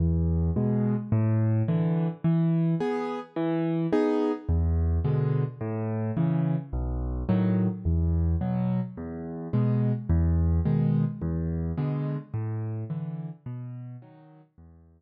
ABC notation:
X:1
M:6/8
L:1/8
Q:3/8=107
K:E
V:1 name="Acoustic Grand Piano"
E,,3 [B,,G,]3 | A,,3 [=D,E,]3 | E,3 [B,G]3 | E,3 [B,DG]3 |
E,,3 [B,,=D,G,]3 | A,,3 [C,E,]3 | B,,,3 [A,,D,F,]3 | E,,3 [B,,F,]3 |
E,,3 [B,,G,]3 | E,,3 [B,,D,G,]3 | E,,3 [B,,=D,G,]3 | A,,3 [=D,E,]3 |
B,,3 [D,F,]3 | E,,3 z3 |]